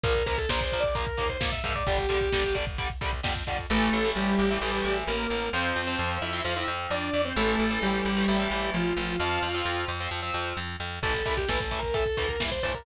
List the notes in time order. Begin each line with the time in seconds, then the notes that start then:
0.04 A#1 F3 A#3 A#4, kick, closed hi-hat
0.15 kick
0.26 C#2 F3 A#3 A#4, kick, closed hi-hat
0.38 A4, kick
0.49 A#1 F3 A#3 C5, kick, snare
0.61 C5, kick
0.72 F3 A#3, kick, closed hi-hat
0.80 D5, kick
0.95 F3 A#3 A#4, kick, closed hi-hat
1.07 kick
1.17 D#2 F3 A#3, kick, closed hi-hat
1.29 C5, kick
1.40 G#2 F3 A#3, kick, snare
1.52 E5, kick
1.64 G#2 F3 A#3 E5, kick, closed hi-hat
1.75 D5, kick
1.87 G1 D3 G3 G4, kick, closed hi-hat
1.98 kick
2.09 A#1 D3 G3, kick, closed hi-hat
2.21 kick
2.32 G1 D3 G3, kick, snare
2.44 kick
2.55 D3 G3, kick, closed hi-hat
2.67 kick
2.78 D3 G3, kick, closed hi-hat
2.90 kick
3.01 C2 D3 G3, kick, closed hi-hat
3.13 kick
3.23 F2 D3 G3, kick, snare
3.36 kick
3.47 F2 D3 G3, kick, closed hi-hat
3.59 kick
3.70 A1 E3 A3 A4
3.93 A1
4.05 E3 A3
4.16 A1 G3 G4
4.39 A1
4.51 E3 A3
4.61 A1 E3 A3
4.73 E3 A3
4.84 A1
5.07 A1 A#3 A#4
5.30 A1
5.53 F2 F3 C4 C5
5.76 F2
5.87 F3 C4
5.99 F2
6.22 F2 E4 E5
6.33 F3 C4
6.44 F2 F3 C4 F4 F5
6.56 F3 C4 E4 E5
6.68 F2
6.91 F2 D4 D5
7.13 F2
7.25 C4 C5
7.36 A1 E3 A3 A4
7.59 A1
7.71 E3 A3
7.82 A1 G3 G4
8.05 A1
8.17 E3 A3
8.28 A1 E3 A3
8.39 E3 A3
8.51 A1
8.74 A1 F3 F4
8.97 A1
9.19 F2 F3 C4 F4 F5
9.42 F2
9.54 F3 C4
9.65 F2
9.88 F2
10.00 F3 C4
10.11 F2 F3 C4
10.22 F3 C4
10.34 F2
10.57 F2
10.80 F2
11.03 A1 E3 A3 A4, kick, crash
11.14 kick
11.26 C2 E3 A3 A4, kick, closed hi-hat
11.37 G4, kick
11.48 A1 E3 A3 A4, kick, snare
11.60 A4, kick
11.71 E3 A3, kick, closed hi-hat
11.79 A#4, kick
11.94 E3 A3 A4, kick, closed hi-hat
12.06 kick
12.17 D2 E3 A3, kick, closed hi-hat
12.29 A#4, kick
12.40 G2 E3 A3, kick, snare
12.51 C5, kick
12.63 G2 E3 A3 C5, kick, closed hi-hat
12.74 A#4, kick